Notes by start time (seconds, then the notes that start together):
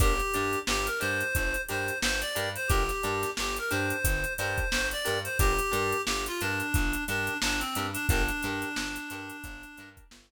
0.00 G1 D4 G4 A#4, kick, closed hi-hat
0.19 closed hi-hat
0.34 G2 D4 G4 A#4, closed hi-hat
0.53 closed hi-hat
0.67 G1 G4, snare
0.86 A#4, closed hi-hat
1.00 G2 D4 G4 A#4 C5, closed hi-hat
1.21 closed hi-hat
1.35 G1, kick, closed hi-hat
1.54 closed hi-hat
1.69 G2 D4 G4 A#4 C5, closed hi-hat
1.88 closed hi-hat
2.02 G1 C5, snare
2.21 D5, closed hi-hat
2.35 G2 D4 G4 A#4, closed hi-hat
2.55 C5, closed hi-hat
2.68 G1 D4 G4 A#4, kick, closed hi-hat
2.89 snare, closed hi-hat
3.03 G2 D4 G4 A#4, closed hi-hat
3.23 snare, closed hi-hat
3.37 G1 G4, snare
3.56 A#4, closed hi-hat
3.70 G2 D4 G4 A#4 C5, closed hi-hat
3.90 closed hi-hat
4.04 G1, kick, closed hi-hat
4.24 closed hi-hat
4.38 G2 D4 G4 A#4 C5, closed hi-hat
4.58 kick, closed hi-hat
4.70 G1 C5, snare
4.91 D5, closed hi-hat
5.05 G2 D4 G4 A#4, snare, closed hi-hat
5.24 C5, closed hi-hat
5.39 G1 D4 G4 A#4, kick, closed hi-hat
5.59 closed hi-hat
5.71 G2 D4 G4 A#4, closed hi-hat
5.92 closed hi-hat
6.06 G1 G4, snare
6.26 F4, closed hi-hat
6.41 G2 D4 G4 A#4, closed hi-hat
6.60 closed hi-hat
6.74 G1, kick, closed hi-hat
6.93 closed hi-hat
7.07 G2 D4 G4 A#4, closed hi-hat
7.27 closed hi-hat
7.42 G1 D4, snare
7.59 C4, closed hi-hat
7.75 G2 D4 G4 A#4, snare, closed hi-hat
7.93 D4, closed hi-hat
8.09 G1 D4 G4 A#4, kick, closed hi-hat
8.29 closed hi-hat
8.43 G2 D4 G4 A#4, closed hi-hat
8.62 closed hi-hat
8.76 G1, snare
8.96 closed hi-hat
9.10 G2 D4 G4 A#4, closed hi-hat
9.30 closed hi-hat
9.44 G1, kick, closed hi-hat
9.63 closed hi-hat
9.78 G2 D4 G4 A#4, closed hi-hat
9.97 kick, closed hi-hat
10.11 G1, snare